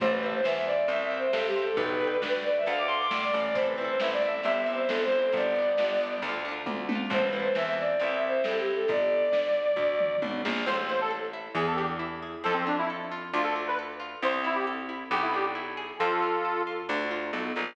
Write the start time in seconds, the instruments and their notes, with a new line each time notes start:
0.00 electric bass (finger) A1, violin C5, orchestral harp C5 E5, kick, crash
0.07 violin B4, orchestral harp A5
0.22 violin B4, orchestral harp C5
0.26 orchestral harp E5 A5
0.34 violin C5
0.44 electric bass (finger) E2, orchestral harp C5 E5, violin E5, snare
0.51 orchestral harp A5
0.56 violin E5
0.66 violin D5
0.88 electric bass (finger) C2, orchestral harp C5, violin E5, closed hi-hat
0.92 orchestral harp E5 G5
1.02 violin E5
1.11 orchestral harp C5 E5
1.17 violin C5, orchestral harp G5
1.32 electric bass (finger) G2, violin A4, orchestral harp C5, snare
1.37 orchestral harp E5 G5
1.47 violin G4
1.56 orchestral harp C5 E5
1.62 violin A4, orchestral harp G5
1.76 electric bass (finger) B1, violin B4, orchestral harp B4 D5, kick, closed hi-hat
1.83 orchestral harp G5
2.01 orchestral harp B4 D5
2.07 orchestral harp G5
2.22 electric bass (finger) D2, orchestral harp B4 D5, snare
2.28 orchestral harp G5
2.44 violin D5
2.58 violin E5
2.66 electric bass (finger) D2, orchestral harp A4 D5, violin F5, closed hi-hat
2.73 orchestral harp F5
2.78 violin D6
2.87 orchestral harp A4, violin C6
2.92 orchestral harp D5 F5
3.00 violin D6
3.11 electric bass (finger) A2, orchestral harp A4 D5, violin D6, snare
3.17 orchestral harp F5
3.22 violin D5
3.34 electric bass (finger) A1, orchestral harp A4 D5
3.40 violin D5, orchestral harp F5
3.54 orchestral harp C4, violin C5, kick, closed hi-hat
3.59 orchestral harp E4 A4
3.67 violin B4
3.78 orchestral harp C4 E4, violin B4
3.84 orchestral harp A4, violin C5
4.00 electric bass (finger) A1, orchestral harp C4, violin E5, snare
4.04 orchestral harp E4 A4
4.12 violin D5
4.22 orchestral harp C4 E4, violin E5
4.29 orchestral harp A4
4.43 electric bass (finger) G1, orchestral harp C4, violin E5, closed hi-hat
4.48 orchestral harp E4 G4
4.59 violin E5
4.66 orchestral harp C4 E4
4.73 orchestral harp G4, violin C5
4.88 electric bass (finger) G1, violin A4, snare
5.04 violin C5
5.12 orchestral harp C4 E4
5.18 orchestral harp G4, violin C5
5.32 electric bass (finger) G1, orchestral harp B3, violin D5, kick, closed hi-hat
5.37 orchestral harp D4 G4
5.55 orchestral harp B3 D4
5.62 orchestral harp G4
5.77 electric bass (finger) G1, orchestral harp B3 D4, snare
5.84 orchestral harp G4
6.00 orchestral harp B3 D4
6.06 orchestral harp G4
6.22 electric bass (finger) D2, orchestral harp A3 D4, closed hi-hat
6.29 orchestral harp F4
6.45 orchestral harp A3 D4
6.51 orchestral harp F4
6.66 electric bass (finger) D2, kick, high tom
6.89 orchestral harp A3 D4, high tom
6.95 orchestral harp F4
7.10 electric bass (finger) A1, orchestral harp C4, violin C5, kick, crash
7.15 orchestral harp E4 A4
7.22 violin B4
7.32 orchestral harp C4 E4, violin B4
7.39 orchestral harp A4
7.43 violin C5
7.55 electric bass (finger) E2, orchestral harp C4 E4, violin E5, snare
7.62 orchestral harp A4, violin E5
7.79 violin D5
8.00 electric bass (finger) C2, orchestral harp C4 E4, violin E5, closed hi-hat
8.06 orchestral harp G4
8.15 violin E5
8.28 violin C5
8.44 electric bass (finger) G2, orchestral harp C4, violin A4, snare
8.48 orchestral harp E4 G4
8.60 violin G4
8.75 violin A4
8.88 electric bass (finger) G1, violin D5, kick, closed hi-hat
9.32 electric bass (finger) D2, snare
9.76 electric bass (finger) D2, kick, floor tom
10.00 mid tom
10.22 electric bass (finger) B1, high tom
10.45 electric bass (finger) A#1, snare
10.66 electric bass (finger) A1, orchestral harp C4, accordion C5
10.89 orchestral harp E4, accordion C5
11.01 accordion A4
11.11 orchestral harp A4
11.33 orchestral harp E4
11.55 electric bass (finger) E2, orchestral harp B3, accordion G#4
11.67 accordion A4
11.76 orchestral harp D4, accordion G4
11.99 orchestral harp E4
12.22 orchestral harp G#4
12.44 electric bass (finger) F2, orchestral harp C4, accordion A4
12.54 accordion C4
12.67 accordion D4, orchestral harp F4
12.79 accordion E4
12.90 orchestral harp A4
13.12 orchestral harp F4
13.34 electric bass (finger) D2, orchestral harp D4, accordion F4
13.44 accordion A4
13.56 orchestral harp F4
13.68 accordion B4
13.79 orchestral harp A4
14.00 orchestral harp F4
14.22 electric bass (finger) C2, orchestral harp C4, accordion C5
14.44 orchestral harp E4, accordion E4
14.55 accordion G4
14.67 orchestral harp A4
14.89 orchestral harp E4
15.11 electric bass (finger) B1, orchestral harp B3, accordion G4
15.22 accordion E4
15.34 orchestral harp D4, accordion G4
15.55 orchestral harp E4
15.77 orchestral harp G#4
15.99 electric bass (finger) F2, orchestral harp C4, accordion F4 A4
16.22 orchestral harp F4
16.45 orchestral harp A4
16.67 orchestral harp F4
16.89 electric bass (finger) D2, orchestral harp D4
17.11 orchestral harp F4
17.33 electric bass (finger) B1, orchestral harp A4
17.56 electric bass (finger) A#1, orchestral harp F4